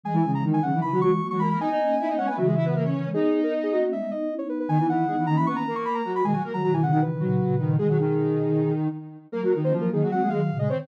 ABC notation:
X:1
M:4/4
L:1/16
Q:1/4=155
K:G#m
V:1 name="Ocarina"
g3 a z g f2 b2 c'3 c' b b | g6 f g e6 z2 | G3 A z G F2 e2 d3 c B B | g2 f4 a b c' a2 c' b a2 b |
g g z a a g f f B8 | G12 z4 | [K:Bbm] B3 c z B A2 g2 f3 e d d |]
V:2 name="Ocarina"
[G,G] [E,E] [C,C]2 [D,D]2 [C,C] [E,E] [E,E] [F,F] [F,F] z2 [F,F] [A,A] [A,A] | [Dd] [Dd]3 [Ee] [Dd] [Cc] [B,B] [F,F] [G,G] [Ee] [B,B] [A,A] [Cc]3 | [Dd]8 z8 | [D,D] [E,E] [E,E]2 [G,G] [E,E] [D,D] [E,E] [B,B]2 [A,A]4 [F,F]2 |
[G,G] [F,F] [A,A] [F,F] [F,F] [E,E] [C,C] [D,D] z2 [F,F]4 [D,D]2 | [G,G] [F,F] [D,D]10 z4 | [K:Bbm] [B,B] [G,G] [E,E]2 [F,F]2 [E,E] [G,G] [G,G] [A,A] [A,A] z2 [A,A] [Cc] [Cc] |]
V:3 name="Ocarina"
[E,G,]2 [E,G,] [E,G,]3 [D,F,] [D,F,] [C,E,] [C,E,] [E,G,]2 [F,A,] [E,G,]3 | [B,D] [B,D] [A,C]2 [B,D] [A,C] [G,B,] [A,C] [C,E,]6 [C,E,] [E,G,] | [B,D]2 [B,D] [B,D]3 [A,C] [A,C] [G,B,] [G,B,] [B,D]2 [CE] [B,D]3 | [B,D] [B,D]2 z [B,D]2 [A,C]4 z6 |
[B,,D,] z2 [D,F,] [B,,D,]4 [C,E,] [B,,D,] [A,,C,]2 [A,,C,]2 [A,,C,]2 | [B,,D,]10 z6 | [K:Bbm] [G,B,] z2 [B,D] [G,B,]4 [A,C] [G,B,] [E,G,]2 [B,,D,]2 [C,E,]2 |]